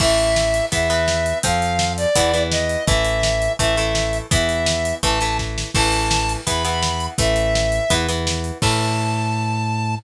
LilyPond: <<
  \new Staff \with { instrumentName = "Lead 1 (square)" } { \time 4/4 \key a \minor \tempo 4 = 167 e''2 e''2 | f''4. d''4. dis''4 | e''2 e''2 | e''2 a''4 r4 |
a''2 b''2 | e''2~ e''8 r4. | a''1 | }
  \new Staff \with { instrumentName = "Acoustic Guitar (steel)" } { \time 4/4 \key a \minor <e a>2 <e b>8 <e b>4. | <f c'>2 <e b>8 <e b>4. | <e a>2 <e a>8 <e a>4. | <e b>2 <e a>8 <e a>4. |
<e a>2 <e b>8 <e b>4. | <e a>2 <e b>8 <e b>4. | <e a>1 | }
  \new Staff \with { instrumentName = "Synth Bass 1" } { \clef bass \time 4/4 \key a \minor a,,2 e,2 | f,2 e,2 | a,,2 a,,2 | e,2 a,,2 |
a,,2 e,2 | a,,2 e,2 | a,1 | }
  \new DrumStaff \with { instrumentName = "Drums" } \drummode { \time 4/4 <cymc bd>8 hh8 sn8 hh8 <hh bd>8 hh8 sn8 hh8 | <hh bd>8 hh8 sn8 hh8 <hh bd>8 hh8 sn8 hh8 | <hh bd>8 hh8 sn8 hh8 <hh bd>8 hh8 sn8 hh8 | <hh bd>8 hh8 sn8 hh8 <hh bd>8 hh8 <bd sn>8 sn8 |
<cymc bd>8 hh8 sn8 hh8 <hh bd>8 hh8 sn8 hh8 | <hh bd>8 hh8 sn8 hh8 <hh bd>8 hh8 sn8 hh8 | <cymc bd>4 r4 r4 r4 | }
>>